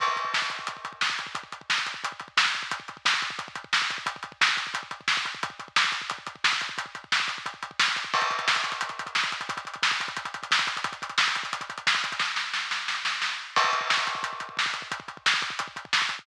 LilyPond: \new DrumStaff \drummode { \time 4/4 \tempo 4 = 177 <cymc bd>16 bd16 <hh bd>16 bd16 <bd sn>16 bd16 <hh bd>16 bd16 <hh bd>16 bd16 <hh bd>16 bd16 <bd sn>16 bd16 <hh bd>16 bd16 | <hh bd>16 bd16 <hh bd>16 bd16 <bd sn>16 bd16 <hh bd>16 bd16 <hh bd>16 bd16 <hh bd>16 bd16 <bd sn>16 bd16 <hh bd>16 bd16 | <hh bd>16 bd16 <hh bd>16 bd16 <bd sn>16 bd16 <hh bd>16 bd16 <hh bd>16 bd16 <hh bd>16 bd16 <bd sn>16 bd16 <hh bd>16 bd16 | <hh bd>16 bd16 <hh bd>16 bd16 <bd sn>16 bd16 <hh bd>16 bd16 <hh bd>16 bd16 <hh bd>16 bd16 <bd sn>16 bd16 <hh bd>16 bd16 |
<hh bd>16 bd16 <hh bd>16 bd16 <bd sn>16 bd16 <hh bd>16 bd16 <hh bd>16 bd16 <hh bd>16 bd16 <bd sn>16 bd16 <hh bd>16 bd16 | <hh bd>16 bd16 <hh bd>16 bd16 <bd sn>16 bd16 <hh bd>16 bd16 <hh bd>16 bd16 <hh bd>16 bd16 <bd sn>16 bd16 <hh bd>16 bd16 | <cymc bd>16 <hh bd>16 <hh bd>16 <hh bd>16 <bd sn>16 <hh bd>16 <hh bd>16 <hh bd>16 <hh bd>16 <hh bd>16 <hh bd>16 <hh bd>16 <bd sn>16 <hh bd>16 <hh bd>16 <hh bd>16 | <hh bd>16 <hh bd>16 <hh bd>16 <hh bd>16 <bd sn>16 <hh bd>16 <hh bd>16 <hh bd>16 <hh bd>16 <hh bd>16 <hh bd>16 <hh bd>16 <bd sn>16 <hh bd>16 <hh bd>16 <hh bd>16 |
<hh bd>16 <hh bd>16 <hh bd>16 <hh bd>16 <bd sn>16 <hh bd>16 <hh bd>16 <hh bd>16 <hh bd>16 <hh bd>16 <hh bd>16 <hh bd>16 <bd sn>16 <hh bd>16 <hh bd>16 <hh bd>16 | <bd sn>8 sn8 sn8 sn8 sn8 sn8 sn4 | <cymc bd>16 bd16 <hh bd>16 bd16 <bd sn>16 bd16 <hh bd>16 bd16 <hh bd>16 bd16 <hh bd>16 bd16 <bd sn>16 bd16 <hh bd>16 bd16 | <hh bd>16 bd16 <hh bd>16 bd16 <bd sn>16 bd16 <hh bd>16 bd16 <hh bd>16 bd16 <hh bd>16 bd16 <bd sn>16 bd16 <hh bd>16 bd16 | }